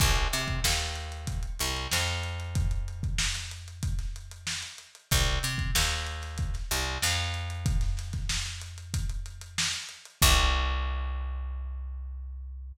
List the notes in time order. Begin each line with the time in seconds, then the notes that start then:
0.00 C2, kick, crash
0.16 closed hi-hat
0.33 C3, closed hi-hat
0.48 kick, closed hi-hat
0.64 D#2, snare
0.80 snare, closed hi-hat
0.95 closed hi-hat
1.12 closed hi-hat
1.27 kick, closed hi-hat
1.43 closed hi-hat
1.59 C2, closed hi-hat
1.76 closed hi-hat
1.91 F2, snare
2.08 closed hi-hat
2.23 closed hi-hat
2.40 closed hi-hat
2.55 kick, closed hi-hat
2.71 closed hi-hat
2.88 closed hi-hat
3.03 kick, closed hi-hat
3.18 snare
3.34 snare, closed hi-hat
3.51 closed hi-hat
3.68 closed hi-hat
3.83 kick, closed hi-hat
3.99 snare, closed hi-hat
4.16 closed hi-hat
4.31 closed hi-hat
4.47 snare
4.63 closed hi-hat
4.78 closed hi-hat
4.95 closed hi-hat
5.11 C2, kick, closed hi-hat
5.27 closed hi-hat
5.43 C3, closed hi-hat
5.58 kick, closed hi-hat
5.75 D#2, snare
5.90 snare, closed hi-hat
6.07 closed hi-hat
6.22 snare, closed hi-hat
6.38 kick, closed hi-hat
6.54 snare, closed hi-hat
6.71 C2, closed hi-hat
6.86 closed hi-hat
7.02 F2, snare
7.18 closed hi-hat
7.34 closed hi-hat
7.50 closed hi-hat
7.66 kick, closed hi-hat
7.81 snare, closed hi-hat
7.97 snare, closed hi-hat
8.13 kick, snare, closed hi-hat
8.29 snare
8.46 snare, closed hi-hat
8.61 closed hi-hat
8.78 closed hi-hat
8.94 kick, closed hi-hat
9.09 closed hi-hat
9.26 closed hi-hat
9.41 closed hi-hat
9.58 snare
9.73 closed hi-hat
9.89 closed hi-hat
10.05 closed hi-hat
10.22 C2, kick, crash